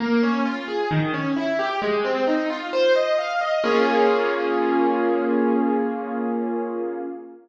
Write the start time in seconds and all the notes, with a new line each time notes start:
0.00 A#3
0.23 C#4
0.45 F4
0.68 G#4
0.91 D#3
1.14 C#4
1.36 E4
1.59 G4
1.82 G#3
2.05 C4
2.27 D#4
2.50 F4
2.73 C5
2.96 D#5
3.18 F5
3.41 D#5
3.64 A#3 C#4 F4 G#4